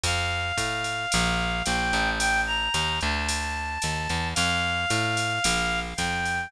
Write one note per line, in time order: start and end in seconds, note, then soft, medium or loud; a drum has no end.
0.03 0.52 F2 loud
0.03 1.63 F5 medium
0.03 kick medium
0.03 ride medium
0.57 1.06 A2 medium
0.57 kick medium
0.57 hi-hat pedal medium
0.57 ride medium
0.84 ride medium
1.12 1.63 A#1 loud
1.12 ride loud
1.65 1.92 A#1 loud
1.65 2.10 G5 medium
1.65 hi-hat pedal medium
1.65 ride medium
1.93 2.69 A1 loud
1.93 ride medium
2.19 2.41 G5 loud
2.19 ride medium
2.47 2.99 A#5 medium
2.74 3.00 D#2 loud
2.74 hi-hat pedal medium
2.74 ride medium
3.01 3.78 D2 loud
3.01 4.29 A5 medium
3.01 ride medium
3.29 ride medium
3.82 4.08 D#2 medium
3.82 hi-hat pedal medium
3.82 ride medium
4.09 4.34 E2 medium
4.09 ride medium
4.35 4.86 F2 loud
4.35 5.80 F5 medium
4.35 ride medium
4.90 5.39 A2 loud
4.90 hi-hat pedal medium
4.90 ride medium
5.17 ride medium
5.44 5.94 A#1 loud
5.44 ride loud
5.97 6.47 F2 medium
5.97 6.49 G5 medium
5.97 kick medium
5.97 hi-hat pedal medium
5.97 ride medium
6.25 ride medium